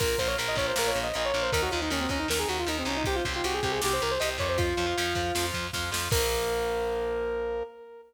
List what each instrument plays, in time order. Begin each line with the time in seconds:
0.00 electric bass (finger) A#1, overdriven guitar F4 A#4, lead 2 (sawtooth) A#4, kick, crash
0.18 electric bass (finger) A#1, overdriven guitar F4 A#4, lead 2 (sawtooth) C5, kick, ride
0.27 overdriven guitar F4 A#4, lead 2 (sawtooth) C#5
0.38 electric bass (finger) A#1, overdriven guitar F4 A#4, ride
0.48 lead 2 (sawtooth) D#5
0.55 electric bass (finger) A#1, overdriven guitar F4 A#4, lead 2 (sawtooth) C#5, kick, ride
0.68 lead 2 (sawtooth) C5
0.76 electric bass (finger) A#1, overdriven guitar F4 A#4, lead 2 (sawtooth) A#4, snare
0.88 lead 2 (sawtooth) C#5
0.94 electric bass (finger) A#1, ride
1.03 lead 2 (sawtooth) D#5
1.14 electric bass (finger) A#1, overdriven guitar F4 A#4, lead 2 (sawtooth) D#5, ride
1.25 lead 2 (sawtooth) C#5
1.34 electric bass (finger) A#1, overdriven guitar F4 A#4, ride
1.43 lead 2 (sawtooth) C5
1.52 electric bass (finger) D#2, overdriven guitar D#4 A#4, lead 2 (sawtooth) A#4, kick, ride
1.62 lead 2 (sawtooth) F#4
1.71 electric bass (finger) D#2, overdriven guitar D#4 A#4, lead 2 (sawtooth) F4, ride
1.82 lead 2 (sawtooth) D#4, overdriven guitar D#4 A#4
1.90 electric bass (finger) D#2, lead 2 (sawtooth) C#4, overdriven guitar D#4 A#4, ride
2.01 lead 2 (sawtooth) C4
2.09 electric bass (finger) D#2, lead 2 (sawtooth) C#4, overdriven guitar D#4 A#4, kick, ride
2.19 lead 2 (sawtooth) D#4
2.28 electric bass (finger) D#2, overdriven guitar D#4 A#4, lead 2 (sawtooth) A#4, snare
2.39 lead 2 (sawtooth) G#4
2.49 electric bass (finger) D#2, lead 2 (sawtooth) F#4, ride
2.59 lead 2 (sawtooth) F4
2.67 electric bass (finger) D#2, overdriven guitar D#4 A#4, lead 2 (sawtooth) D#4, ride
2.79 lead 2 (sawtooth) C4
2.85 electric bass (finger) C2, lead 2 (sawtooth) C#4, overdriven guitar D#4 A#4, ride
2.97 lead 2 (sawtooth) D#4
3.04 overdriven guitar G4 C5, lead 2 (sawtooth) G4, kick, ride
3.16 lead 2 (sawtooth) F4
3.25 electric bass (finger) C2, overdriven guitar G4 C5, kick, ride
3.34 lead 2 (sawtooth) F4, overdriven guitar G4 C5
3.44 electric bass (finger) C2, lead 2 (sawtooth) F#4, overdriven guitar G4 C5, ride
3.54 lead 2 (sawtooth) G#4
3.63 electric bass (finger) C2, lead 2 (sawtooth) G4, overdriven guitar G4 C5, kick, ride
3.72 lead 2 (sawtooth) G#4
3.81 electric bass (finger) C2, overdriven guitar G4 C5, lead 2 (sawtooth) G4, snare
3.93 lead 2 (sawtooth) C5
4.00 electric bass (finger) C2, lead 2 (sawtooth) A#4, ride
4.11 lead 2 (sawtooth) C5
4.20 electric bass (finger) C2, overdriven guitar G4 C5, lead 2 (sawtooth) D#5, ride
4.38 electric bass (finger) F2, overdriven guitar G4 C5, lead 2 (sawtooth) C#5, kick, ride
4.49 lead 2 (sawtooth) C5
4.58 lead 2 (sawtooth) F4, overdriven guitar F4 C5, kick, ride
4.77 electric bass (finger) F2, overdriven guitar F4 C5, ride
4.87 overdriven guitar F4 C5
4.98 electric bass (finger) F2, overdriven guitar F4 C5, ride
5.15 electric bass (finger) F2, overdriven guitar F4 C5, kick, ride
5.35 electric bass (finger) F2, overdriven guitar F4 C5, snare
5.54 electric bass (finger) F2, kick, ride
5.73 electric bass (finger) F2, overdriven guitar F4 C5, kick, snare
5.91 electric bass (finger) F2, overdriven guitar F4 C5, snare
6.11 electric bass (finger) A#1, overdriven guitar F3 A#3, lead 2 (sawtooth) A#4, kick, crash